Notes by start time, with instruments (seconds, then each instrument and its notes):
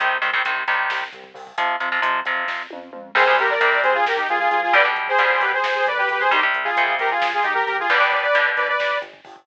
0.00 synth bass 1 C2, overdriven guitar C3 D#3 G3, kick, closed hi-hat
0.11 kick
0.22 synth bass 1 C2, overdriven guitar C3 D#3 G3, kick, closed hi-hat
0.33 overdriven guitar C3 D#3 G3, kick
0.45 synth bass 1 C2, overdriven guitar C3 D#3 G3, kick, closed hi-hat
0.56 kick
0.67 synth bass 1 C2, overdriven guitar C3 D#3 G3, kick, closed hi-hat
0.79 kick
0.90 synth bass 1 C2, kick, snare
1.02 kick
1.13 synth bass 1 C2, kick, closed hi-hat
1.24 kick
1.34 synth bass 1 C2, kick, open hi-hat
1.47 kick
1.58 synth bass 1 F2, overdriven guitar C3 F3, kick, closed hi-hat
1.69 kick
1.80 synth bass 1 F2, overdriven guitar C3 F3, kick, closed hi-hat
1.92 overdriven guitar C3 F3, kick
2.02 synth bass 1 F2, overdriven guitar C3 F3, kick, closed hi-hat
2.14 kick
2.25 synth bass 1 F2, overdriven guitar C3 F3, kick, closed hi-hat
2.37 kick
2.48 synth bass 1 F2, kick, snare
2.70 synth bass 1 F2, high tom
2.93 synth bass 1 F2, mid tom
3.15 synth bass 1 C2, overdriven guitar C3 G3, lead 2 (sawtooth) G#4 C5, kick, crash
3.27 overdriven guitar C3 G3, kick
3.38 synth bass 1 C2, lead 2 (sawtooth) G4 A#4, kick, closed hi-hat
3.50 lead 2 (sawtooth) A#4 D5, kick
3.60 synth bass 1 C2, overdriven guitar C3 G3, kick, closed hi-hat
3.72 kick
3.83 synth bass 1 C2, lead 2 (sawtooth) G#4 C5, kick, closed hi-hat
3.94 lead 2 (sawtooth) F4 G#4, kick
4.06 synth bass 1 C2, lead 2 (sawtooth) G4 A#4, kick, snare
4.17 lead 2 (sawtooth) D#4 G4, kick
4.29 synth bass 1 C2, lead 2 (sawtooth) F4 G#4, kick, closed hi-hat
4.39 lead 2 (sawtooth) F4 G#4, kick
4.50 synth bass 1 C2, lead 2 (sawtooth) F4 G#4, kick, closed hi-hat
4.63 lead 2 (sawtooth) F4 G#4, kick
4.73 synth bass 1 B1, overdriven guitar B2 D3 G3, lead 2 (sawtooth) B4 D5, kick, closed hi-hat
4.85 overdriven guitar B2 D3 G3, kick
4.96 synth bass 1 B1, kick, closed hi-hat
5.08 lead 2 (sawtooth) G#4 C5, kick
5.18 synth bass 1 B1, overdriven guitar B2 D3 G3, kick, closed hi-hat
5.30 kick
5.41 synth bass 1 B1, lead 2 (sawtooth) G4 B4, kick, closed hi-hat
5.53 lead 2 (sawtooth) G#4 C5, kick
5.64 synth bass 1 B1, kick, snare
5.75 lead 2 (sawtooth) G#4 C5, kick
5.86 synth bass 1 B1, lead 2 (sawtooth) B4 D5, kick, closed hi-hat
5.98 lead 2 (sawtooth) G4 B4, kick
6.09 synth bass 1 B1, lead 2 (sawtooth) G4 B4, kick, closed hi-hat
6.20 lead 2 (sawtooth) G#4 C5, kick
6.31 synth bass 1 C2, overdriven guitar C3 G3, lead 2 (sawtooth) D#4 G4, kick, closed hi-hat
6.43 overdriven guitar C3 G3, kick
6.54 synth bass 1 C2, kick, closed hi-hat
6.64 lead 2 (sawtooth) F4 G#4, kick
6.76 synth bass 1 C2, overdriven guitar C3 G3, kick, closed hi-hat
6.88 kick
6.99 synth bass 1 C2, lead 2 (sawtooth) G4 A#4, kick, closed hi-hat
7.11 lead 2 (sawtooth) F4 G#4, kick
7.22 synth bass 1 C2, kick, snare
7.33 lead 2 (sawtooth) F4 G#4, kick
7.43 synth bass 1 C2, lead 2 (sawtooth) D#4 G4, kick, closed hi-hat
7.54 lead 2 (sawtooth) G4 A#4, kick
7.66 synth bass 1 C2, lead 2 (sawtooth) G4 A#4, kick, closed hi-hat
7.78 lead 2 (sawtooth) F4 G#4, kick
7.89 synth bass 1 G1, overdriven guitar B2 D3 G3, lead 2 (sawtooth) B4 D5, kick, closed hi-hat
8.00 overdriven guitar B2 D3 G3, kick
8.12 synth bass 1 G1, lead 2 (sawtooth) B4 D5, kick, closed hi-hat
8.22 lead 2 (sawtooth) B4 D5, kick
8.34 synth bass 1 G1, overdriven guitar B2 D3 G3, kick, closed hi-hat
8.46 kick
8.57 synth bass 1 G1, lead 2 (sawtooth) B4 D5, kick, closed hi-hat
8.68 lead 2 (sawtooth) B4 D5, kick
8.79 synth bass 1 G1, kick, snare
8.91 kick
9.02 synth bass 1 G1, kick, closed hi-hat
9.13 kick
9.25 synth bass 1 G1, kick, open hi-hat
9.36 kick